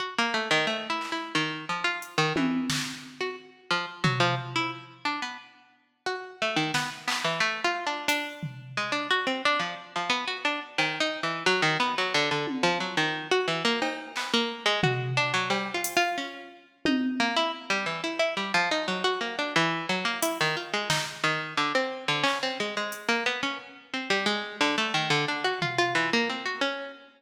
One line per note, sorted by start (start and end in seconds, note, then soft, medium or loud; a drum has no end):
0.00 0.14 F#4 soft
0.18 0.34 A#3 medium
0.34 0.49 A3 medium
0.51 0.66 D#3 loud
0.67 0.87 A3 medium
0.67 cowbell medium
0.90 1.10 E4 medium
1.01 clap medium
1.12 1.32 E4 medium
1.35 1.65 D#3 medium
1.69 1.84 F3 medium
1.84 1.99 F4 medium
2.02 closed hi-hat medium
2.18 2.33 D#3 loud
2.36 2.67 E3 medium
2.36 high tom loud
2.70 snare loud
3.21 3.36 F#4 soft
3.71 3.86 F3 medium
4.04 4.19 F#3 medium
4.04 floor tom loud
4.20 4.35 F3 loud
4.56 4.71 E4 medium
5.05 5.20 D4 medium
5.22 5.37 B3 medium
6.06 6.37 F#4 medium
6.42 6.57 A3 medium
6.56 6.72 D#3 medium
6.74 6.90 B3 medium
6.74 snare medium
7.08 7.23 B3 medium
7.08 clap loud
7.24 7.40 E3 medium
7.40 7.61 A3 loud
7.64 7.85 F4 loud
7.87 8.07 D4 medium
8.08 8.69 D4 loud
8.08 closed hi-hat medium
8.43 floor tom medium
8.77 8.92 G#3 medium
8.92 9.07 D4 medium
9.11 9.26 F#4 loud
9.27 9.42 C4 medium
9.45 9.61 D4 loud
9.59 9.75 F3 medium
9.96 10.11 F3 medium
10.10 10.25 B3 medium
10.28 10.43 F#4 medium
10.45 10.60 D4 medium
10.78 10.99 D#3 medium
10.78 cowbell medium
11.00 11.21 D#4 loud
11.23 11.44 E3 medium
11.46 11.62 F#3 loud
11.62 11.78 D#3 loud
11.80 11.95 B3 loud
11.98 12.13 F#3 medium
12.14 12.29 D3 loud
12.31 12.46 D3 medium
12.47 high tom medium
12.63 12.78 F3 loud
12.80 12.96 F#3 medium
12.97 13.28 D#3 medium
13.31 13.47 F#4 loud
13.48 13.63 E3 medium
13.65 13.80 A#3 loud
13.82 14.12 D#4 medium
13.82 cowbell loud
14.16 14.32 B3 soft
14.16 clap medium
14.34 14.64 A#3 loud
14.66 14.81 G#3 loud
14.83 15.14 F#4 medium
14.83 floor tom loud
15.17 15.32 D4 loud
15.34 15.49 F#3 loud
15.50 15.70 G3 medium
15.50 cowbell loud
15.74 15.95 F4 medium
15.84 closed hi-hat loud
15.97 16.17 F4 loud
16.18 16.48 C#4 medium
16.85 17.16 D#4 medium
16.85 high tom loud
17.20 17.35 A#3 loud
17.37 17.52 E4 loud
17.70 17.85 G3 medium
17.86 18.01 E3 medium
18.04 18.19 E4 medium
18.19 18.35 E4 medium
18.37 18.52 G3 medium
18.54 18.69 F3 loud
18.71 18.87 D#4 medium
18.88 19.03 F#3 medium
19.04 19.19 F#4 loud
19.21 19.36 A#3 medium
19.21 cowbell medium
19.39 19.54 D4 medium
19.56 19.86 E3 loud
19.89 20.04 F#3 medium
20.05 20.20 A#3 medium
20.22 20.38 E4 medium
20.22 closed hi-hat loud
20.41 20.56 D#3 loud
20.57 20.72 F4 soft
20.74 20.89 G#3 medium
20.90 21.05 D#4 medium
20.90 snare loud
21.24 21.54 D#3 medium
21.57 21.73 D3 medium
21.75 22.05 C4 medium
22.08 22.23 D3 medium
22.23 22.39 C#4 medium
22.23 clap medium
22.43 22.58 C4 medium
22.60 22.75 G#3 medium
22.77 23.07 G#3 medium
22.92 closed hi-hat medium
23.09 23.24 A#3 medium
23.26 23.41 B3 medium
23.43 23.58 C#4 medium
23.94 24.09 C4 soft
24.10 24.25 G3 medium
24.26 24.56 G#3 loud
24.61 24.76 D3 loud
24.61 clap soft
24.78 24.93 A3 loud
24.94 25.09 D#3 loud
25.10 25.25 D3 loud
25.28 25.44 D4 medium
25.44 25.60 F#4 medium
25.62 25.77 F4 medium
25.62 floor tom medium
25.78 25.94 F4 loud
25.95 26.10 E3 medium
26.13 26.29 A#3 loud
26.29 26.45 C4 medium
26.46 26.61 F#4 medium
26.61 26.92 C#4 medium